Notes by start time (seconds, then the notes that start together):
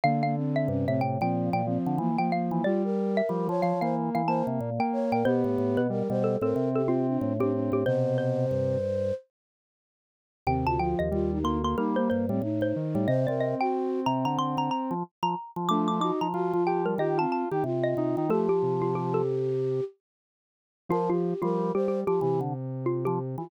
0.04 D3 A#3 F5
0.23 A#3 F5
0.36 C4
0.56 E5
0.68 G2 C3 C#4
0.87 A2 C3 C4 E5
1.01 A2 G5
1.21 A#2 F3 C4 G5
1.53 A#2 A#3 G5
1.66 F3 C4
1.86 D3
1.98 E3 A#3
2.18 F3 A#3 G5
2.32 A#3 F5
2.51 E3 A#3
2.64 G3 F4 D5
2.84 A#4
3.17 E5
3.29 F3 G3
3.47 F3 C#5
3.62 F3 F5
3.81 E3 A#3 C5 F5
4.15 E3 F5
4.27 A#3 C5 A5
4.47 C3
4.61 A#2
4.79 A#3 G5
4.93 C#5
5.12 A#2 A#4 G5
5.25 B2 B3 G4 C5
5.44 A2
5.58 A2
5.77 B2 B4
5.90 G3 A#4
6.09 B2 G3 C5
6.24 A4
6.41 A2 C4 A4 A#4
6.56 C3
6.75 G4 A4
6.88 C4 F4
7.08 D4
7.21 A2
7.39 A2 C4 D4 G4
7.53 D4
7.72 A2 G4
7.86 B2 C3 C5
8.18 C5
8.51 G2
10.47 D#2 C3 C4 G5
10.67 D2 F4 A5
10.79 F3 F4 G5
10.99 D#2 D#5
11.11 D#2 G3 F4
11.32 D#4
11.44 D2 A#3 C6
11.64 A#3 C6
11.77 G3 A#3 D#4 A#4
11.96 A#3 C5
12.10 G2 C5
12.29 A2 G3 C4
12.42 A2 D#4
12.61 A2 C5
12.76 D#3
12.95 A2 G3
13.08 C3 C5 D#5
13.27 C3 C4 A#4 D5
13.40 D#5
13.60 F#4 G5
14.06 C3 A#5
14.25 D3 A#5
14.38 D3 C6
14.57 D3 A#5
14.71 A#5
14.91 F3
15.23 F3 A#5
15.56 F3
15.69 F3 A3 D4 D6
15.88 F4 D6
16.00 D#4 F#4 D6
16.21 F3 A#5
16.34 F3 F4 F#4
16.53 F3 F4
16.67 G4 G5
16.86 G3 A#4
16.98 D#3 F4 G4 D#5
17.17 C4 F4 A5
17.32 A5
17.51 D#3 D#4 G4
17.64 C3 F4
17.84 D#5
17.97 C3 D#4
18.17 D#3 D#4
18.29 F3 A3 G4 A4
18.49 G4
18.63 C3
18.82 F4
18.95 G4
19.14 A4
20.89 F3 F4 A#4
21.10 F4 G4
21.42 F3 G3 F4 A#4
21.74 G3 G4 C5
21.88 G4
22.07 F3 G4
22.21 C3 E3 G4
22.41 D3
22.86 F4
23.05 F3 G4
23.38 E3 F4